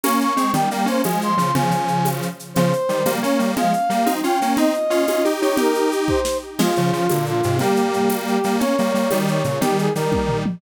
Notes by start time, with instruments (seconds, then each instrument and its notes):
0.04 lead 1 (square) A#3 C#4, brass section C#6, tambourine, high conga, shaker
0.20 brass section C#6, shaker
0.37 lead 1 (square) G#3 C4, shaker
0.53 lead 1 (square) D#3 G3, brass section G5, low conga, shaker
0.70 lead 1 (square) G3 A#3, brass section G5, shaker
0.86 lead 1 (square) A#3 C#4, brass section C5, shaker
1.04 lead 1 (square) F3 G#3, brass section G#5, tambourine, high conga, shaker
1.21 brass section C6, shaker
1.37 lead 1 (square) C#3 F3, shaker
1.55 lead 1 (square) C#3 F3, brass section G#5, low conga, shaker
1.70 lead 1 (square) C#3 F3, shaker
1.88 shaker
2.05 tambourine, high conga, shaker
2.22 shaker
2.39 shaker
2.54 lead 1 (square) C#3 F3, brass section C5, low conga, shaker
2.73 shaker
2.89 lead 1 (square) D#3 G3, shaker
3.05 lead 1 (square) G3 A#3, tambourine, high conga, shaker
3.21 lead 1 (square) A#3 C#4, brass section C#5, shaker
3.39 lead 1 (square) G3 A#3, shaker
3.56 lead 1 (square) F3 G#3, brass section F5, low conga, shaker
3.73 shaker
3.90 lead 1 (square) G3 A#3, shaker
4.06 lead 1 (square) C4 D#4, tambourine, high conga, shaker
4.23 lead 1 (square) C#4 F4, brass section G5, shaker
4.41 lead 1 (square) A#3 C#4, shaker
4.57 lead 1 (square) C4 D#4, brass section D#5, low conga, shaker
4.74 shaker
4.90 lead 1 (square) C#4 F4, shaker
5.07 lead 1 (square) C#4 F4, tambourine, high conga, shaker
5.25 lead 1 (square) D#4 G4, shaker
5.41 lead 1 (square) D#4 G4, brass section C#5, shaker
5.57 lead 1 (square) D#4 G4, brass section A#4, low conga, shaker
5.75 shaker
5.92 shaker
6.08 brass section C5, kick
6.25 snare
6.59 lead 1 (square) F3 G#3, brass section F4, crash, low conga, shaker
6.76 lead 1 (square) C#3 F3, shaker
6.93 lead 1 (square) C#3 F3, shaker
7.09 lead 1 (square) A#2 D3, tambourine, high conga, shaker
7.26 brass section F4, shaker
7.43 lead 1 (square) G#2 C3, shaker
7.59 lead 1 (square) G3 A#3, brass section G4, low conga, shaker
7.76 shaker
7.93 shaker
8.10 tambourine, high conga, shaker
8.27 brass section G4, shaker
8.43 lead 1 (square) G3 A#3, shaker
8.60 lead 1 (square) A#3 C#4, brass section C#5, low conga, shaker
8.78 lead 1 (square) G3 A#3, shaker
8.94 lead 1 (square) G3 A#3, shaker
9.10 lead 1 (square) D#3 G3, tambourine, high conga, shaker
9.27 brass section C#5, shaker
9.44 lead 1 (square) A#2 C#3, shaker
9.61 lead 1 (square) D#3 G3, brass section G4, low conga, shaker
9.78 brass section G#4, shaker
9.95 lead 1 (square) D#3 G3, brass section A#4, shaker
10.12 kick, high tom
10.29 floor tom
10.46 mid tom